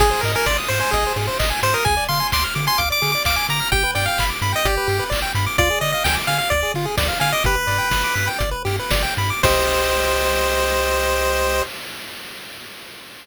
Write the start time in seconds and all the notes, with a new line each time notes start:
0.00 G#1 G#4, kick, crash
0.11 C5
0.21 G#2 A#4, open hi-hat
0.25 D#5
0.35 A#4 G#5
0.46 G#1 D5 C6, kick, snare
0.58 D#6
0.68 G#2 C5 C6, open hi-hat
0.80 C5 G#5
0.91 G#1 G#4 D#5, kick, closed hi-hat
1.06 C5
1.16 G#2 G#4, open hi-hat
1.27 C5
1.39 G#1 D#5, kick, clap
1.50 G#5
1.63 G#2 C5 C6, open hi-hat
1.74 A#4 D#6
1.85 D2 G#4 G#5, kick, closed hi-hat
1.97 D5
2.09 D3 F5 C6, open hi-hat
2.20 G#5
2.32 D2 C6 D6, kick, clap
2.44 F6
2.55 D3 D6, open hi-hat
2.67 G#5 C6
2.78 D2 F5 D6, kick, closed hi-hat
2.90 D5 D6
3.02 D3 G#4, open hi-hat
3.12 D5 D6
3.25 D2 F5 D6, kick, clap
3.36 G#5 D6
3.49 D3 A#5 D6, open hi-hat
3.60 F6
3.72 G1 G4 G5, kick, closed hi-hat
3.84 B4
3.95 G2 D5 G5, open hi-hat
4.06 F5 G5
4.18 G1 B5, kick, clap
4.30 D6
4.42 G2 B5, open hi-hat
4.52 D#5 G5
4.65 G1 G4 D5, kick, closed hi-hat
4.77 B4
4.87 G2 G4, open hi-hat
4.99 B4
5.10 G1 D5, kick, clap
5.22 G5
5.35 G2 B5, open hi-hat
5.46 D6
5.58 D2 F4 D5, kick, closed hi-hat
5.70 G#4
5.81 D3 D5 D#5, open hi-hat
5.92 D#5 F5
6.04 D2 G5 G#5, kick, snare
6.15 D6
6.27 D3 F5 G#5, open hi-hat
6.38 F5
6.50 D2 D5, kick, closed hi-hat
6.63 G#4
6.74 D3 F4, open hi-hat
6.85 G#4
6.97 D2 D5, kick, snare
7.08 F5
7.20 D3 F5 G#5, open hi-hat
7.32 D#5 D6
7.44 G1 G4 B4, kick, closed hi-hat
7.56 B4
7.67 G2 D5, open hi-hat
7.78 G5
7.91 G1 B5, kick, snare
8.04 D6
8.15 G2 B5, open hi-hat
8.27 G5
8.39 G1 D5, kick, closed hi-hat
8.51 B4
8.65 G2 G4, open hi-hat
8.79 B4
8.90 G1 D5, kick, snare
9.02 G5
9.17 G2 B5, open hi-hat
9.30 D6
9.43 C2 G4 C5 D#5, kick, crash